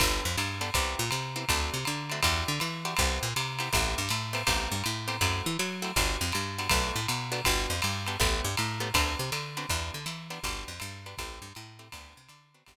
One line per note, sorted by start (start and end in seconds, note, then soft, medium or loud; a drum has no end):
0.00 0.21 G1 loud
0.00 0.29 B3 loud
0.00 0.29 D4 loud
0.00 0.29 G4 loud
0.00 0.29 A4 loud
0.00 kick medium
0.00 crash loud
0.00 ride loud
0.25 0.36 F2 loud
0.37 0.71 G2 medium
0.37 hi-hat pedal medium
0.37 ride loud
0.61 0.70 B3 loud
0.61 0.70 D4 medium
0.61 0.70 G4 medium
0.61 0.70 A4 medium
0.61 ride medium
0.74 0.95 C2 loud
0.74 1.04 B3 loud
0.74 1.04 C4 loud
0.74 1.04 E4 loud
0.74 1.04 G4 loud
0.74 kick medium
0.74 ride loud
0.99 1.10 A#2 loud
1.11 1.45 C3 medium
1.11 hi-hat pedal loud
1.11 ride loud
1.36 1.45 B3 medium
1.36 1.45 C4 medium
1.36 1.45 E4 medium
1.36 1.45 G4 medium
1.36 ride medium
1.49 1.70 D2 loud
1.49 1.79 A3 loud
1.49 1.79 C4 loud
1.49 1.79 D4 loud
1.49 1.79 F#4 loud
1.49 kick medium
1.49 ride loud
1.74 1.85 C3 medium
1.85 2.21 D3 loud
1.85 hi-hat pedal medium
1.85 ride medium
2.10 2.21 A3 medium
2.10 2.21 C4 medium
2.10 2.21 D4 medium
2.10 2.21 F#4 medium
2.10 ride medium
2.23 2.44 E2 loud
2.23 2.52 D4 loud
2.23 2.52 E4 loud
2.23 2.52 F#4 loud
2.23 2.52 G4 loud
2.23 kick medium
2.23 ride loud
2.48 2.59 D3 loud
2.60 2.95 E3 medium
2.60 hi-hat pedal medium
2.60 ride medium
2.85 2.94 D4 medium
2.85 2.94 E4 medium
2.85 2.94 F#4 loud
2.85 2.94 G4 medium
2.85 ride medium
2.97 3.19 C2 loud
2.97 3.28 B3 loud
2.97 3.28 C4 loud
2.97 3.28 E4 loud
2.97 3.28 G4 loud
2.97 kick medium
2.97 ride loud
3.23 3.34 A#2 loud
3.36 3.70 C3 loud
3.36 hi-hat pedal medium
3.36 ride loud
3.59 3.69 B3 medium
3.59 3.69 C4 loud
3.59 3.69 E4 medium
3.59 3.69 G4 loud
3.59 ride medium
3.73 3.95 A1 loud
3.73 4.02 A3 loud
3.73 4.02 B3 loud
3.73 4.02 C4 loud
3.73 4.02 G4 loud
3.73 kick medium
3.73 ride loud
3.98 4.09 G2 loud
4.09 4.44 A2 loud
4.09 hi-hat pedal loud
4.09 ride medium
4.33 4.42 A3 medium
4.33 4.42 B3 medium
4.33 4.42 C4 medium
4.33 4.42 G4 loud
4.33 ride loud
4.47 4.68 A1 loud
4.47 4.76 A3 loud
4.47 4.76 B3 loud
4.47 4.76 C4 loud
4.47 4.76 G4 loud
4.47 kick medium
4.47 ride loud
4.72 4.83 G2 medium
4.84 5.19 A2 loud
4.84 hi-hat pedal medium
4.84 ride medium
5.08 5.17 A3 medium
5.08 5.17 B3 medium
5.08 5.17 C4 medium
5.08 5.17 G4 loud
5.08 ride medium
5.21 5.42 F#2 loud
5.21 5.50 A3 loud
5.21 5.50 C4 loud
5.21 5.50 E4 loud
5.21 5.50 F#4 loud
5.21 kick medium
5.21 ride loud
5.46 5.57 E3 loud
5.59 5.93 F#3 loud
5.59 hi-hat pedal loud
5.59 ride medium
5.82 5.91 A3 medium
5.82 5.91 C4 medium
5.82 5.91 E4 medium
5.82 5.91 F#4 medium
5.82 ride medium
5.96 6.17 G1 loud
5.96 6.27 B3 loud
5.96 6.27 D4 loud
5.96 6.27 F#4 loud
5.96 6.27 G4 loud
5.96 kick medium
5.96 ride loud
6.21 6.32 F2 loud
6.32 6.68 G2 medium
6.32 hi-hat pedal medium
6.32 ride medium
6.58 6.68 B3 medium
6.58 6.68 D4 medium
6.58 6.68 F#4 medium
6.58 6.68 G4 medium
6.58 ride medium
6.69 6.92 B1 loud
6.69 7.00 A3 loud
6.69 7.00 B3 loud
6.69 7.00 D4 loud
6.69 7.00 F#4 loud
6.69 kick medium
6.69 ride loud
6.96 7.07 A2 medium
7.08 7.42 B2 medium
7.08 hi-hat pedal medium
7.08 ride loud
7.32 7.41 A3 medium
7.32 7.41 B3 loud
7.32 7.41 D4 loud
7.32 7.41 F#4 loud
7.32 ride medium
7.45 7.67 G1 loud
7.45 7.75 B3 loud
7.45 7.75 D4 loud
7.45 7.75 F#4 loud
7.45 7.75 G4 loud
7.45 kick medium
7.45 ride loud
7.70 7.81 F2 medium
7.82 8.17 G2 medium
7.82 hi-hat pedal medium
7.82 ride loud
8.07 8.17 B3 medium
8.07 8.17 D4 medium
8.07 8.17 F#4 medium
8.07 8.17 G4 loud
8.07 ride medium
8.20 8.41 A1 loud
8.20 8.49 A3 loud
8.20 8.49 B3 loud
8.20 8.49 C#4 loud
8.20 8.49 G4 loud
8.20 kick medium
8.20 ride loud
8.44 8.56 G2 medium
8.57 8.92 A2 medium
8.57 hi-hat pedal medium
8.57 ride loud
8.80 8.89 A3 loud
8.80 8.89 B3 loud
8.80 8.89 C#4 medium
8.80 8.89 G4 medium
8.80 ride medium
8.94 9.15 D2 loud
8.94 9.24 B3 loud
8.94 9.24 C4 loud
8.94 9.24 D4 loud
8.94 9.24 F#4 loud
8.94 kick medium
8.94 ride loud
9.19 9.30 C3 loud
9.32 9.65 D3 medium
9.32 hi-hat pedal medium
9.32 ride loud
9.57 9.66 B3 medium
9.57 9.66 C4 medium
9.57 9.66 D4 loud
9.57 9.66 F#4 medium
9.57 ride medium
9.69 9.91 E2 loud
9.69 9.99 B3 loud
9.69 9.99 D4 loud
9.69 9.99 E4 loud
9.69 9.99 G4 loud
9.69 kick medium
9.69 ride loud
9.94 10.05 D3 medium
10.06 10.39 E3 loud
10.06 hi-hat pedal loud
10.06 ride medium
10.30 10.39 B3 medium
10.30 10.39 D4 medium
10.30 10.39 E4 medium
10.30 10.39 G4 medium
10.30 ride medium
10.43 10.64 G1 loud
10.43 10.73 B3 loud
10.43 10.73 D4 loud
10.43 10.73 F#4 loud
10.43 10.73 G4 loud
10.43 kick medium
10.43 ride loud
10.68 10.79 F2 medium
10.80 11.15 G2 loud
10.80 hi-hat pedal medium
10.80 ride loud
11.06 11.15 B3 loud
11.06 11.15 D4 medium
11.06 11.15 F#4 medium
11.06 11.15 G4 medium
11.06 ride medium
11.18 11.39 A1 loud
11.18 11.48 A3 loud
11.18 11.48 C4 loud
11.18 11.48 E4 loud
11.18 11.48 G4 loud
11.18 kick medium
11.18 ride loud
11.42 11.53 G2 loud
11.55 11.90 A2 loud
11.55 hi-hat pedal medium
11.55 ride medium
11.79 11.88 A3 medium
11.79 11.88 C4 medium
11.79 11.88 E4 medium
11.79 11.88 G4 medium
11.79 ride medium
11.92 12.14 D2 loud
11.92 12.22 B3 loud
11.92 12.22 C4 loud
11.92 12.22 D4 loud
11.92 12.22 F#4 loud
11.92 kick medium
11.92 ride loud
12.17 12.28 C3 medium
12.29 12.63 D3 loud
12.29 hi-hat pedal medium
12.29 ride loud
12.54 12.64 B3 medium
12.54 12.64 C4 medium
12.54 12.64 D4 medium
12.54 12.64 F#4 medium
12.54 ride medium
12.66 12.76 G1 loud
12.66 12.76 B3 loud
12.66 12.76 D4 loud
12.66 12.76 F#4 loud
12.66 12.76 G4 loud
12.66 kick medium
12.66 ride loud